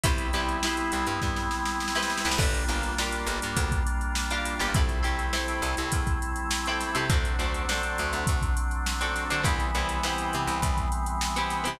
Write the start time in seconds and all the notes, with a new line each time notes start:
0.04 C2 G3 B3 C4 E4 G4 B4 C5, kick, closed hi-hat
0.18 closed hi-hat
0.33 C2 E4 G4 B4 C5, closed hi-hat
0.49 closed hi-hat
0.63 E4 G4 B4 C5, snare
0.77 closed hi-hat
0.92 C2, closed hi-hat
1.07 G2, closed hi-hat
1.22 G2, kick, snare
1.36 snare
1.51 snare
1.66 snare
1.80 snare
1.88 snare
1.95 E4 G4 B4 C5, snare
2.03 snare
2.10 snare
2.18 snare
2.25 C2 E4 G4 B4 C5, snare
2.31 snare
2.38 G1 G3 A#3 D4 F4 G4 A#4, kick, crash
2.54 closed hi-hat
2.68 G1 D4 F4 G4 A#4, closed hi-hat
2.83 closed hi-hat
2.98 D4 F4 G4 A#4, snare
3.12 closed hi-hat
3.27 G1, closed hi-hat
3.42 G2, closed hi-hat
3.57 D2, kick, closed hi-hat
3.72 kick, closed hi-hat
3.87 closed hi-hat
4.01 closed hi-hat
4.15 snare
4.31 D4 F4 G4 A#4, closed hi-hat
4.45 snare, closed hi-hat
4.59 G1 D4 F4 G4 A#4, snare, closed hi-hat
4.74 C2 G3 A3 C4 E4 G4 A4, kick, closed hi-hat
4.89 snare, closed hi-hat
5.03 C2 C4 E4 G4 A4, closed hi-hat
5.18 snare, closed hi-hat
5.33 C4 E4 G4 A4, snare
5.48 snare, closed hi-hat
5.62 C2, closed hi-hat
5.77 C2, closed hi-hat
5.92 E2, kick, closed hi-hat
6.07 kick, closed hi-hat
6.22 closed hi-hat
6.36 closed hi-hat
6.51 snare
6.66 C4 E4 G4 A4, closed hi-hat
6.81 snare, closed hi-hat
6.95 C3 C4 E4 G4 A4, closed hi-hat
7.10 D2 F#3 A3 C4 D4 F#4 A4, kick, closed hi-hat
7.25 closed hi-hat
7.39 D2 C4 D4 F#4 A4, closed hi-hat
7.54 closed hi-hat
7.69 C4 D4 F#4 A4, snare
7.83 closed hi-hat
7.98 D2, closed hi-hat
8.13 D2, closed hi-hat
8.27 D2, kick, closed hi-hat
8.42 kick, closed hi-hat
8.57 closed hi-hat
8.71 closed hi-hat
8.86 snare
9.01 C4 D4 F#4 A4, closed hi-hat
9.16 snare, closed hi-hat
9.30 D3 C4 D4 F#4 A4, closed hi-hat
9.43 C2 E3 G3 B3 C4 E4 G4, kick, closed hi-hat
9.60 closed hi-hat
9.75 C2 B3 C4 E4 G4, closed hi-hat
9.89 closed hi-hat
10.03 B3 C4 E4 G4, snare
10.18 closed hi-hat
10.33 C3, closed hi-hat
10.48 C2, closed hi-hat
10.62 C2, kick, closed hi-hat
10.78 kick, closed hi-hat
10.92 closed hi-hat
11.06 closed hi-hat
11.21 snare
11.36 B3 C4 E4 G4, closed hi-hat
11.50 snare, closed hi-hat
11.64 C3 B3 C4 E4 G4, closed hi-hat